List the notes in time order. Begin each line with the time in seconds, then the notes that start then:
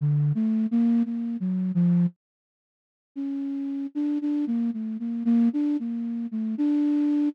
0.01 D3
0.35 A3
0.71 A#3
1.05 A#3
1.40 F#3
1.75 F3
3.16 C#4
3.95 D4
4.21 D4
4.47 A#3
4.73 A3
5.00 A#3
5.25 A#3
5.53 D4
5.79 A#3
6.31 A3
6.58 D4